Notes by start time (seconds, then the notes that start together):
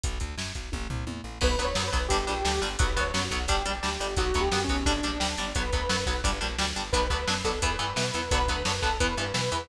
0.03 B1, kick, closed hi-hat
0.20 D2, kick, closed hi-hat
0.38 F#2, snare
0.55 B1, kick, closed hi-hat
0.72 A1, kick, high tom
0.90 C2, floor tom
1.07 E2, high tom
1.24 A1
1.41 B1 F#3 B3 B4, kick, crash
1.58 D2 F#3 B3, kick, closed hi-hat
1.64 C#5
1.75 F#2 F#3 B3, snare
1.87 B4
1.93 B1 F#3 B3, kick, closed hi-hat
2.08 G1 G3 D4 G4, kick, closed hi-hat
2.27 A#1 G3 D4, closed hi-hat
2.45 D2 G3 D4, snare
2.62 G1 G3 D4, closed hi-hat
2.78 B1 F#3 B3 B4, kick, closed hi-hat
2.96 D2 F#3 B3 C#5, kick, closed hi-hat
3.14 F#2 F#3 B3, snare
3.24 F#4
3.31 B1 F#3 B3, kick, closed hi-hat
3.48 G1 G3 D4 G4, kick, closed hi-hat
3.65 A#1 G3 D4, closed hi-hat
3.83 D2 G3 D4, snare
4.00 G1 G3 D4, closed hi-hat
4.17 B1 F#3 B3 F#4, kick, closed hi-hat
4.34 D2 F#3 B3, kick, closed hi-hat
4.41 G4
4.52 F#2 F#3 B3, snare
4.64 C#4
4.68 B1 F#3 B3, kick, closed hi-hat
4.86 G1 G3 D4, kick, closed hi-hat
5.03 A#1 G3 D4, closed hi-hat
5.20 D2 G3 D4, snare
5.37 G1 G3 D4, closed hi-hat
5.55 B1 F#3 B3 B4, kick, closed hi-hat
5.72 D2 F#3 B3, kick, closed hi-hat
5.89 F#2 F#3 B3, snare
6.06 B1 F#3 B3, kick, closed hi-hat
6.24 G1 G3 D4, kick, closed hi-hat
6.41 A#1 G3 D4, closed hi-hat
6.58 D2 G3 D4, snare
6.76 G1 G3 D4, closed hi-hat
6.92 B1 F#3 B3 D4 B4, kick, closed hi-hat
7.10 D2 F#3 B3 D4, kick, closed hi-hat
7.28 F#2 F#3 B3 D4, snare
7.44 B1 F#3 B3 D4 A4, kick, closed hi-hat
7.62 E2 E3 B3 B4, kick, closed hi-hat
7.79 G2 E3 B3, closed hi-hat
7.96 B2 E3 B3 B4, snare
8.14 E2 E3 B3, closed hi-hat
8.31 B1 D3 F#3 B3 B4, kick, closed hi-hat
8.48 D2 D3 F#3 B3, kick, closed hi-hat
8.65 F#2 D3 F#3 B3, snare
8.82 B1 D3 F#3 B3 A4, kick, closed hi-hat
9.00 E2 E3 B3 B4, kick, closed hi-hat
9.17 G2 E3 B3, closed hi-hat
9.34 B2 E3 B3 B4, snare
9.52 E2 E3 B3, closed hi-hat